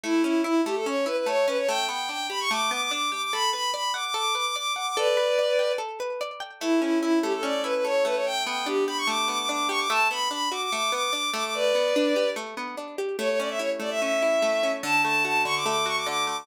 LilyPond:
<<
  \new Staff \with { instrumentName = "Violin" } { \time 4/4 \key a \mixolydian \tempo 4 = 146 e'8 e'8 e'8 g'16 a'16 cis''8 b'16 b'16 cis''8 b'16 cis''16 | g''8 g''8 g''8 b''16 cis'''16 d'''8 d'''16 d'''16 d'''8 d'''16 d'''16 | b''8 b''8 b''8 d'''16 d'''16 d'''8 d'''16 d'''16 d'''8 d'''16 d'''16 | <b' d''>2 r2 |
e'8 e'8 e'8 g'16 a'16 d''8 b'16 b'16 cis''8 b'16 cis''16 | g''8 g''8 g'8 b''16 cis'''16 d'''8 d'''16 d'''16 d'''8 cis'''16 d'''16 | a''8 b''8 b''8 d'''16 d'''16 d'''8 d'''16 d'''16 d'''8 d'''16 d'''16 | <b' d''>2 r2 |
cis''16 cis''16 d''16 e''16 cis''16 r16 d''16 e''16 e''2 | a''8 a''8 a''8 cis'''16 d'''16 d'''8 cis'''16 d'''16 d'''8 d'''16 d'''16 | }
  \new Staff \with { instrumentName = "Acoustic Guitar (steel)" } { \time 4/4 \key a \mixolydian a8 cis'8 e'8 a8 cis'8 e'8 a8 cis'8 | a8 b8 d'8 g'8 a8 b8 d'8 g'8 | a'8 b'8 d''8 fis''8 a'8 b'8 d''8 fis''8 | a'8 b'8 d''8 g''8 a'8 b'8 d''8 g''8 |
a8 cis'8 e'8 a8 cis'8 e'8 a8 a8~ | a8 b8 d'8 g'8 a8 b8 d'8 g'8 | a8 b8 d'8 fis'8 a8 b8 d'8 a8~ | a8 b8 d'8 g'8 a8 b8 d'8 g'8 |
a8 cis'8 e'8 a8 cis'8 e'8 a8 cis'8 | d8 a8 fis'8 d8 a8 fis'8 d8 a8 | }
>>